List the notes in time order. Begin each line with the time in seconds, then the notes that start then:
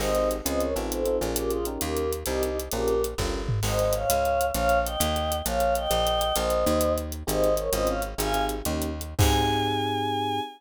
0.00 G#1 C4 D#4 G4 G#4 C5 D#5, crash
0.15 C4 D#4 G4 G#4, closed hi-hat
0.31 closed hi-hat
0.45 C#2 C4 C#4 F4 G#4 C5 D#5, closed hi-hat
0.60 A#4 C#5, closed hi-hat
0.75 A1 C4 D#4 F4 A4, closed hi-hat
0.91 A4 C5, closed hi-hat
1.05 C4 D#4 F4 A4, closed hi-hat
1.21 A#1 C#4 F4 G#4 A#4, closed hi-hat
1.36 G4 A#4, closed hi-hat
1.51 F4 G#4, closed hi-hat
1.65 C#4 D#4 G4 A#4, closed hi-hat
1.81 D#2 G4 A#4, closed hi-hat
1.97 closed hi-hat
2.12 closed hi-hat
2.26 C2 C4 D#4 G4 A#4, closed hi-hat
2.43 D#4 G4, closed hi-hat
2.60 closed hi-hat
2.71 A#1 C#4 F4 G4 G#4 A#4, closed hi-hat
2.88 closed hi-hat
3.04 closed hi-hat
3.18 G1 C#4 F4 G4 A#4, kick, snare
3.49 floor tom
3.63 G#1 C5 D#5, crash
3.79 closed hi-hat
3.93 C#5 F5, closed hi-hat
4.10 C#2, closed hi-hat
4.25 closed hi-hat
4.41 closed hi-hat
4.54 A#1 C#5 F5, closed hi-hat
4.69 closed hi-hat
4.85 D#5 G5, closed hi-hat
5.00 D#2, closed hi-hat
5.16 closed hi-hat
5.32 closed hi-hat
5.45 A#1 C#5 F5, closed hi-hat
5.60 closed hi-hat
5.75 D#5 G5, closed hi-hat
5.91 A#1, closed hi-hat
6.07 closed hi-hat
6.21 closed hi-hat
6.36 A#1 C5 D#5, closed hi-hat
6.50 closed hi-hat
6.66 D#2, closed hi-hat
6.81 closed hi-hat
6.98 closed hi-hat
7.12 closed hi-hat
7.27 G#1 C4 D#4 G4 G#4 C5 D#5, closed hi-hat
7.44 closed hi-hat
7.57 A#4 C#5, closed hi-hat
7.73 G#1 C4 C#4 F4 G#4 C5 D#5, closed hi-hat
7.87 C#5 F5, closed hi-hat
8.02 closed hi-hat
8.18 G#1 C4 D#4 G4 G#4 F5 G#5, closed hi-hat
8.33 C4 D#4 G4 G#4, closed hi-hat
8.49 closed hi-hat
8.65 D#2 A#3 C#4 D#4 G4, closed hi-hat
8.82 closed hi-hat
9.01 closed hi-hat
9.19 G#2 C4 D#4 G4 G#4 G#5, kick, crash